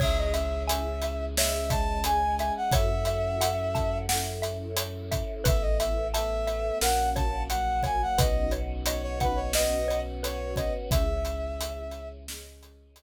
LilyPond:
<<
  \new Staff \with { instrumentName = "Brass Section" } { \time 4/4 \key cis \minor \tempo 4 = 88 e''16 dis''16 e''8 e''4 e''8 a''8 gis''8 gis''16 fis''16 | e''2 r2 | e''16 dis''16 e''8 e''4 fis''8 a''8 fis''8 gis''16 fis''16 | dis''8 r8 cis''16 cis''16 b'16 cis''16 dis''8. r16 cis''8 dis''16 r16 |
e''2 r2 | }
  \new Staff \with { instrumentName = "Xylophone" } { \time 4/4 \key cis \minor cis''8 e''8 gis''8 e''8 cis''8 e''8 gis''8 e''8 | cis''8 e''8 fis''8 a''8 fis''8 e''8 cis''8 e''8 | b'8 e''8 a''8 e''8 ais'8 cis''8 fis''8 cis''8 | b'8 cis''8 dis''8 fis''8 dis''8 cis''8 b'8 cis''8 |
r1 | }
  \new Staff \with { instrumentName = "Synth Bass 2" } { \clef bass \time 4/4 \key cis \minor cis,1 | fis,1 | a,,2 ais,,2 | b,,1 |
cis,1 | }
  \new Staff \with { instrumentName = "Choir Aahs" } { \time 4/4 \key cis \minor <cis' e' gis'>2 <gis cis' gis'>2 | <cis' e' fis' a'>2 <cis' e' a' cis''>2 | <b e' a'>4 <a b a'>4 <ais cis' fis'>4 <fis ais fis'>4 | <b cis' dis' fis'>2 <b cis' fis' b'>2 |
<cis' e' gis'>2 <gis cis' gis'>2 | }
  \new DrumStaff \with { instrumentName = "Drums" } \drummode { \time 4/4 <cymc bd>8 hh8 hh8 hh8 sn8 <hh bd>8 hh8 hh8 | <hh bd>8 hh8 hh8 <hh bd>8 sn8 hh8 hh8 <hh bd>8 | <hh bd>8 hh8 hh8 hh8 sn8 <hh bd>8 hh8 <hh bd>8 | <hh bd>8 hh8 hh8 <hh bd>8 sn8 hh8 hh8 <hh bd>8 |
<hh bd>8 hh8 hh8 hh8 sn8 hh8 hh4 | }
>>